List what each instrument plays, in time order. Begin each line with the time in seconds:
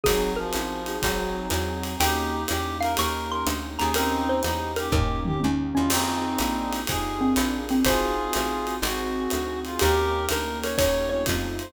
0.04 electric bass (finger) G#1, clarinet F#3, acoustic grand piano C4 D#4 F#4 G#4, pad 5 (bowed) C4 D#4 F#4 G#4, xylophone G#4, kick, ride
0.36 clarinet F3, xylophone A#4
0.53 electric bass (finger) A1, hi-hat pedal, ride
0.86 acoustic grand piano C4 D#4 F#4 G#4, ride
1.02 electric bass (finger) G#1, clarinet F#3, pad 5 (bowed) C4 D#4 F#4 G#4, kick, ride
1.50 electric bass (finger) E2, clarinet F#3, hi-hat pedal, ride
1.84 ride
2.00 electric bass (finger) D#2, pad 5 (bowed) A#3 C#4 D#4 G4, acoustic grand piano A#3 C#4 D#4 G4, clarinet D#4 G4, xylophone G5, ride
2.48 electric bass (finger) E2, clarinet G4, hi-hat pedal, ride
2.81 acoustic grand piano A#3 C#4 D#4 G4, clarinet A#4, xylophone F5, ride
2.97 electric bass (finger) D#2, pad 5 (bowed) A#3 C#4 D#4 G4, acoustic grand piano A#3 C#4 D#4 G4, clarinet A#4, xylophone C#6, ride
3.31 clarinet A#4, xylophone C6
3.46 electric bass (finger) D2, hi-hat pedal, ride
3.79 electric bass (finger) D#2, acoustic grand piano A#3 C#4 D#4 G4, clarinet G#4, xylophone A#5, ride
3.94 pad 5 (bowed) A#3 C#4 D#4 G4, clarinet C4 D#4, xylophone A#4, ride
4.29 xylophone C5
4.43 electric bass (finger) E2, clarinet D#4, hi-hat pedal, ride
4.76 clarinet G4, xylophone A#4, ride
4.92 electric bass (finger) D#2, acoustic grand piano A#3 C#4 D#4 G4, pad 5 (bowed) A#3 C#4 D#4 G4, clarinet G4, xylophone A#4, kick, floor tom
5.25 clarinet G4, mid tom
5.40 electric bass (finger) D#2, xylophone C#4, high tom
5.74 electric bass (finger) E2, acoustic grand piano A#3 C#4 D#4 G4, xylophone C#4, clarinet F4
5.89 electric bass (finger) F2, acoustic grand piano C4 D#4 F4 G#4, pad 5 (bowed) C4 D#4 F4 G#4, clarinet C4 D#4, crash, ride
6.39 electric bass (finger) A#1, pad 5 (bowed) A#3 D4 F4 G#4, acoustic grand piano A#3 D4 F4 G#4, hi-hat pedal, ride
6.73 ride
6.87 electric bass (finger) F2, pad 5 (bowed) D#4 F4 G4 G#4, acoustic grand piano D#4 F4 G4 G#4, clarinet G#4, kick, ride
7.18 xylophone C4, acoustic grand piano D4 F4 G#4 A#4
7.36 electric bass (finger) A#1, pad 5 (bowed) D4 F4 G#4 A#4, hi-hat pedal, ride
7.69 xylophone C4, ride
7.85 electric bass (finger) G#1, pad 5 (bowed) C4 D#4 F#4 G#4, acoustic grand piano C4 D#4 F#4 G#4, clarinet F4 G#4, xylophone C5, kick, ride
8.33 electric bass (finger) A1, hi-hat pedal, ride
8.67 acoustic grand piano C4 D#4 F#4 G#4, ride
8.82 electric bass (finger) G#1, pad 5 (bowed) C4 D#4 F#4 G#4, acoustic grand piano C4 D#4 F#4 G#4, clarinet F#4, ride
9.30 electric bass (finger) D2, hi-hat pedal, ride
9.65 clarinet F4, ride
9.79 electric bass (finger) D#2, pad 5 (bowed) A#3 C#4 D#4 G4, acoustic grand piano A#3 C#4 D#4 G4, clarinet G4 A#4, xylophone G4, ride
10.28 electric bass (finger) D2, clarinet A#4, xylophone A#4, hi-hat pedal, ride
10.63 xylophone A#4, clarinet C#5, ride
10.78 electric bass (finger) D#2, acoustic grand piano A#3 C#4 D#4 G4, pad 5 (bowed) A#3 C#4 D#4 G4, xylophone C#5, clarinet C#5, kick, ride
11.09 acoustic grand piano A3 C4 D#4 F4, xylophone C#5, clarinet C#5
11.26 electric bass (finger) F2, pad 5 (bowed) A3 C4 D#4 F4, kick, hi-hat pedal, ride
11.59 clarinet C5, ride